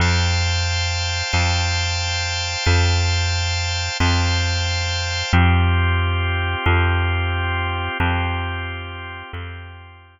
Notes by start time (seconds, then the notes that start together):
0.00 F2 C5 F5 G5 A5
1.33 F2 C5 F5 G5 A5
2.65 F2 C5 F5 G5 A5
4.00 F2 C5 F5 G5 A5
5.33 F2 C4 F4 G4
6.66 F2 C4 F4 G4
8.00 F2 C4 F4 G4
9.33 F2 C4 F4 G4